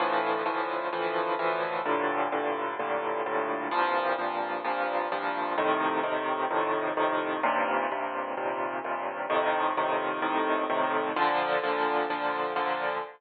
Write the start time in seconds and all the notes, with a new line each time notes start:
0.00 D2 A2 E3 F3
0.46 D2 A2 E3 F3
0.93 D2 A2 E3 F3
1.39 D2 A2 E3 F3
1.86 G2 A2 A#2 D3
2.32 G2 A2 A#2 D3
2.79 G2 A2 A#2 D3
3.26 G2 A2 A#2 D3
3.71 C2 G2 A#2 F3
4.19 C2 G2 A#2 F3
4.64 C2 G2 A#2 F3
5.12 C2 G2 A#2 F3
5.58 F2 A2 C3 D#3
6.03 F2 A2 C3 D#3
6.50 F2 A2 C3 D#3
6.97 F2 A2 C3 D#3
7.43 D#2 G2 A#2 C3
7.91 D#2 G2 A#2 C3
8.37 D#2 G2 A#2 C3
8.84 D#2 G2 A#2 C3
9.30 F2 A2 C3 D#3
9.77 F2 A2 C3 D#3
10.22 F2 A2 C3 D#3
10.70 F2 A2 C3 D#3
11.16 A#2 D3 F3
11.63 A#2 D3 F3
12.10 A#2 D3 F3
12.56 A#2 D3 F3